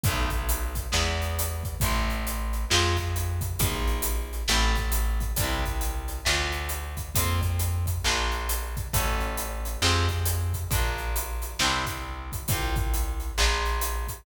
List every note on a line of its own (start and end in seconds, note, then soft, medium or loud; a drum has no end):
0.04 0.88 B1 medium
0.04 0.93 F#3 medium
0.04 0.93 A3 medium
0.04 kick loud
0.04 closed hi-hat loud
0.09 0.93 B3 medium
0.09 0.93 D#4 medium
0.30 kick medium
0.30 closed hi-hat medium
0.49 closed hi-hat loud
0.75 kick medium
0.75 closed hi-hat medium
0.92 1.77 E2 medium
0.92 1.79 G#3 medium
0.92 1.79 B3 medium
0.92 1.79 E4 medium
0.92 snare loud
1.22 closed hi-hat medium
1.39 closed hi-hat loud
1.63 kick loud
1.63 closed hi-hat medium
1.80 2.65 A1 medium
1.80 2.69 A3 medium
1.80 2.69 C4 medium
1.80 kick loud
1.80 closed hi-hat loud
1.85 2.69 E4 medium
2.10 closed hi-hat medium
2.27 closed hi-hat loud
2.53 closed hi-hat medium
2.70 3.55 F2 medium
2.70 3.58 G#3 medium
2.70 3.58 C4 medium
2.70 3.58 F4 medium
2.70 snare loud
2.97 kick medium
2.97 closed hi-hat medium
3.16 closed hi-hat loud
3.41 kick loud
3.41 closed hi-hat medium
3.59 4.43 A#1 medium
3.59 4.47 A#3 medium
3.59 4.47 D#4 medium
3.59 kick loud
3.59 closed hi-hat loud
3.64 4.47 F4 medium
3.87 closed hi-hat medium
4.02 closed hi-hat loud
4.33 closed hi-hat medium
4.48 5.32 A1 medium
4.48 5.36 A3 medium
4.48 5.36 C4 medium
4.48 snare loud
4.48 closed hi-hat medium
4.53 5.36 E4 medium
4.75 kick medium
4.75 closed hi-hat medium
4.92 closed hi-hat loud
5.20 kick medium
5.20 closed hi-hat medium
5.36 6.21 C2 medium
5.36 6.25 G3 medium
5.36 6.25 C4 medium
5.36 kick loud
5.36 closed hi-hat loud
5.42 6.25 D4 medium
5.42 6.25 E4 medium
5.65 kick medium
5.65 closed hi-hat medium
5.81 closed hi-hat loud
6.08 closed hi-hat medium
6.25 7.10 D2 medium
6.25 7.13 A3 medium
6.25 7.13 D4 medium
6.25 7.13 F4 medium
6.25 snare loud
6.52 closed hi-hat medium
6.69 closed hi-hat loud
6.97 kick medium
6.97 closed hi-hat medium
7.15 7.99 F2 medium
7.15 8.02 A#3 medium
7.15 8.02 C4 medium
7.15 8.02 F4 medium
7.15 kick loud
7.15 closed hi-hat loud
7.41 kick loud
7.41 closed hi-hat medium
7.59 closed hi-hat loud
7.86 kick medium
7.86 closed hi-hat medium
8.04 8.88 A#1 medium
8.04 8.92 A#3 medium
8.04 8.92 D4 medium
8.04 snare loud
8.08 8.92 F4 medium
8.32 closed hi-hat medium
8.49 closed hi-hat loud
8.77 kick loud
8.77 closed hi-hat medium
8.93 9.77 A1 medium
8.93 9.81 A3 medium
8.93 9.81 C#4 medium
8.93 9.81 F#4 medium
8.93 kick loud
8.93 closed hi-hat loud
9.20 closed hi-hat medium
9.37 closed hi-hat loud
9.65 closed hi-hat medium
9.82 10.65 F2 medium
9.82 10.70 G#3 medium
9.82 10.70 C4 medium
9.82 snare loud
9.86 10.70 F4 medium
9.86 10.70 G4 medium
10.09 kick medium
10.09 closed hi-hat medium
10.25 closed hi-hat loud
10.53 kick medium
10.53 closed hi-hat medium
10.71 11.54 A#1 medium
10.71 11.59 A#3 medium
10.71 11.59 D4 medium
10.71 kick loud
10.71 closed hi-hat loud
10.75 11.59 F4 medium
10.98 closed hi-hat medium
11.16 closed hi-hat loud
11.42 closed hi-hat medium
11.59 12.43 C2 medium
11.59 12.48 C4 medium
11.59 12.48 D4 medium
11.59 snare loud
11.65 12.48 E4 medium
11.65 12.48 G4 medium
11.86 kick medium
11.86 closed hi-hat medium
12.32 kick medium
12.32 closed hi-hat medium
12.48 13.32 C2 medium
12.48 13.37 C4 medium
12.48 13.37 F4 medium
12.48 kick loud
12.48 closed hi-hat loud
12.53 13.37 G4 medium
12.76 kick loud
12.76 closed hi-hat medium
12.94 closed hi-hat loud
13.20 closed hi-hat medium
13.38 14.21 A#1 medium
13.38 14.25 A#3 medium
13.38 14.25 D4 medium
13.38 14.25 F4 medium
13.38 snare loud
13.65 closed hi-hat medium
13.81 closed hi-hat loud
14.08 kick medium
14.08 closed hi-hat medium